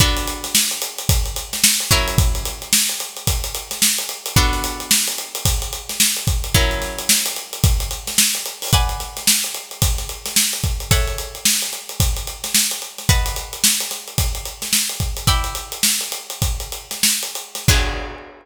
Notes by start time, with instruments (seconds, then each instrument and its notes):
0.00 pizzicato strings B3 D4 F#4 A4, kick, closed hi-hat
0.17 closed hi-hat
0.28 closed hi-hat
0.44 snare, closed hi-hat
0.55 snare
0.71 closed hi-hat
0.82 closed hi-hat
0.98 closed hi-hat
1.09 kick, closed hi-hat
1.26 closed hi-hat
1.36 closed hi-hat
1.53 snare, closed hi-hat
1.64 snare
1.80 closed hi-hat
1.91 pizzicato strings F#3 C#4 E4 A#4, kick, closed hi-hat
2.08 closed hi-hat
2.18 kick, closed hi-hat
2.35 closed hi-hat
2.45 closed hi-hat
2.62 closed hi-hat
2.73 snare
2.89 closed hi-hat
3.00 closed hi-hat
3.16 closed hi-hat
3.27 kick, closed hi-hat
3.44 closed hi-hat
3.55 closed hi-hat
3.71 snare, closed hi-hat
3.82 snare
3.98 closed hi-hat
4.09 closed hi-hat
4.26 closed hi-hat
4.36 pizzicato strings B3 D4 F#4 A4, kick, closed hi-hat
4.53 snare, closed hi-hat
4.64 closed hi-hat
4.80 closed hi-hat
4.91 snare
5.08 closed hi-hat
5.18 closed hi-hat
5.35 closed hi-hat
5.45 kick, closed hi-hat
5.62 closed hi-hat
5.73 closed hi-hat
5.89 snare, closed hi-hat
6.00 snare
6.16 closed hi-hat
6.27 kick, closed hi-hat
6.44 closed hi-hat
6.54 pizzicato strings F#3 C#4 E4 A#4, kick, closed hi-hat
6.71 closed hi-hat
6.82 snare, closed hi-hat
6.99 closed hi-hat
7.09 snare
7.26 closed hi-hat
7.36 closed hi-hat
7.53 closed hi-hat
7.64 kick, closed hi-hat
7.80 closed hi-hat
7.91 closed hi-hat
8.07 snare, closed hi-hat
8.18 snare
8.35 closed hi-hat
8.46 closed hi-hat
8.62 open hi-hat
8.73 pizzicato strings B4 D5 F#5 G#5, kick, closed hi-hat
8.89 closed hi-hat
9.00 snare, closed hi-hat
9.17 snare, closed hi-hat
9.27 snare
9.44 closed hi-hat
9.54 closed hi-hat
9.71 closed hi-hat
9.82 kick, closed hi-hat
9.98 snare, closed hi-hat
10.09 closed hi-hat
10.26 snare, closed hi-hat
10.36 snare
10.53 closed hi-hat
10.64 kick, closed hi-hat
10.80 closed hi-hat
10.91 pizzicato strings A4 C#5 E5 F#5, kick, closed hi-hat
11.07 closed hi-hat
11.18 closed hi-hat
11.35 closed hi-hat
11.45 snare
11.62 closed hi-hat
11.73 closed hi-hat
11.89 closed hi-hat
12.00 kick, closed hi-hat
12.16 closed hi-hat
12.27 closed hi-hat
12.44 snare, closed hi-hat
12.55 snare
12.71 closed hi-hat
12.82 closed hi-hat
12.98 snare, closed hi-hat
13.09 pizzicato strings B4 D#5 F#5 A5, kick, closed hi-hat
13.26 closed hi-hat
13.36 closed hi-hat
13.53 closed hi-hat
13.64 snare
13.80 snare, closed hi-hat
13.91 snare, closed hi-hat
14.08 closed hi-hat
14.18 kick, closed hi-hat
14.35 closed hi-hat
14.45 closed hi-hat
14.62 snare, closed hi-hat
14.73 snare
14.89 closed hi-hat
15.00 kick, closed hi-hat
15.17 closed hi-hat
15.27 pizzicato strings E4 D5 G5 B5, kick, closed hi-hat
15.44 closed hi-hat
15.55 closed hi-hat
15.72 closed hi-hat
15.83 snare
16.01 closed hi-hat
16.12 closed hi-hat
16.30 closed hi-hat
16.42 kick, closed hi-hat
16.60 closed hi-hat
16.72 closed hi-hat
16.91 snare, closed hi-hat
17.03 snare
17.23 closed hi-hat
17.35 closed hi-hat
17.55 snare, closed hi-hat
17.68 pizzicato strings B3 D4 F#4 G#4, kick, crash